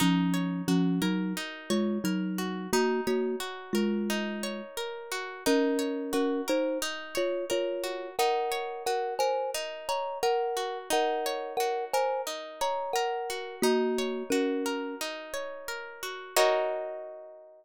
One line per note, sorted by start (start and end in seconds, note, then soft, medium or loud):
0.00 0.62 F3 medium
0.00 0.62 C#4 loud
0.00 1.36 D#4 loud
0.34 1.70 C#5 medium
0.68 0.99 F3 medium
0.68 0.99 C#4 medium
0.68 2.38 F#4 medium
1.02 1.33 F#3 medium
1.02 1.33 D#4 medium
1.02 2.04 A#4 medium
1.37 2.66 D#4 medium
1.70 1.98 G#3 medium
1.70 1.98 F4 medium
1.70 2.67 C#5 medium
2.04 2.67 F#3 medium
2.04 2.67 D#4 medium
2.04 2.70 A#4 medium
2.38 2.71 F#4 medium
2.73 3.01 A#3 medium
2.73 4.09 D#4 loud
2.73 3.01 F#4 loud
3.07 3.36 A#3 medium
3.07 3.36 F#4 medium
3.07 4.43 C#5 medium
3.40 5.11 F#4 medium
3.73 4.61 G#3 medium
3.73 4.61 F4 medium
3.73 4.77 A#4 medium
4.10 5.39 D#4 medium
4.43 5.40 C#5 medium
4.77 5.42 A#4 medium
5.12 5.44 F#4 medium
5.46 6.13 C#4 loud
5.46 6.82 D#4 loud
5.46 6.13 A#4 loud
5.79 7.14 C#5 medium
6.13 6.41 C#4 medium
6.13 7.83 F#4 medium
6.13 6.41 A#4 medium
6.48 6.78 D#4 medium
6.48 7.49 A#4 medium
6.48 6.78 C5 loud
6.82 8.12 D#4 loud
7.15 7.45 F4 medium
7.15 8.12 C#5 medium
7.15 7.45 C#5 medium
7.50 8.09 F4 medium
7.50 8.14 A#4 medium
7.50 8.09 C#5 medium
7.84 8.16 F#4 medium
8.19 9.54 D#4 loud
8.19 8.83 A#4 medium
8.19 8.83 F#5 loud
8.52 9.88 C#5 medium
8.86 10.56 F#4 medium
8.86 9.14 A#4 medium
8.86 9.14 F#5 medium
9.19 10.22 A#4 medium
9.19 9.50 C5 medium
9.19 9.50 G#5 loud
9.54 10.84 D#4 medium
9.89 10.18 C#5 medium
9.89 10.86 C#5 medium
9.89 10.18 A#5 medium
10.23 10.78 A#4 medium
10.23 10.88 A#4 medium
10.23 10.78 F#5 medium
10.57 10.89 F#4 medium
10.90 12.26 D#4 loud
10.90 11.53 A#4 medium
10.90 11.53 F#5 medium
11.26 12.61 C#5 medium
11.57 13.29 F#4 medium
11.57 11.85 A#4 medium
11.57 11.85 F#5 medium
11.93 12.95 A#4 medium
11.93 12.22 C5 medium
11.93 12.22 G#5 loud
12.27 13.56 D#4 medium
12.61 13.58 C#5 medium
12.61 12.92 C#5 medium
12.61 12.92 A#5 medium
12.93 13.56 A#4 medium
12.93 13.60 A#4 medium
12.93 13.56 F#5 medium
13.30 13.62 F#4 medium
13.62 14.23 A#3 loud
13.62 15.00 D#4 loud
13.62 14.23 F#4 loud
13.98 15.33 C#5 medium
14.30 14.95 C#4 medium
14.30 16.02 F#4 medium
14.30 14.95 A#4 medium
14.66 15.68 A#4 medium
15.01 16.31 D#4 medium
15.34 16.31 C#5 medium
15.68 16.33 A#4 medium
16.03 16.35 F#4 medium
16.37 17.65 D#4 loud
16.37 17.65 F#4 loud
16.37 17.65 A#4 loud
16.37 17.65 C#5 loud
16.37 17.65 D#5 loud